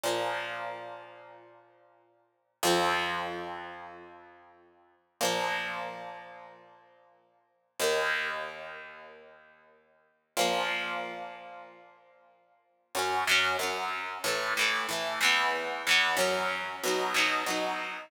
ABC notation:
X:1
M:4/4
L:1/8
Q:1/4=93
K:Fdor
V:1 name="Acoustic Guitar (steel)"
[B,,F,B,]8 | [F,,F,C]8 | [B,,F,B,]8 | [E,,E,B,]8 |
[B,,F,B,]8 | [K:F#dor] [F,,F,C] [F,,F,C] [F,,F,C]2 [A,,E,A,] [A,,E,A,] [A,,E,A,] [E,,E,B,]- | [E,,E,B,] [E,,E,B,] [F,,F,C]2 [B,,F,D] [B,,F,D] [B,,F,D]2 |]